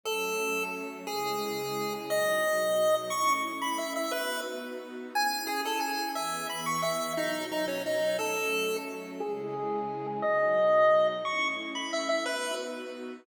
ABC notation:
X:1
M:3/4
L:1/16
Q:1/4=177
K:C#m
V:1 name="Lead 1 (square)"
A8 z4 | G12 | d12 | c'3 z3 b2 e2 e2 |
B4 z8 | g4 G2 A2 g4 | e4 b2 c'2 e4 | D4 D2 C2 D4 |
A8 z4 | G12 | d12 | c'3 z3 b2 e2 e2 |
B4 z8 |]
V:2 name="String Ensemble 1"
[F,A,C]12 | [C,G,E]12 | [B,,F,D]12 | [A,CE]12 |
[B,DF]12 | [CEG]12 | [E,B,G]12 | [B,,F,D]12 |
[F,A,C]12 | [C,G,E]12 | [B,,F,D]12 | [A,CE]12 |
[B,DF]12 |]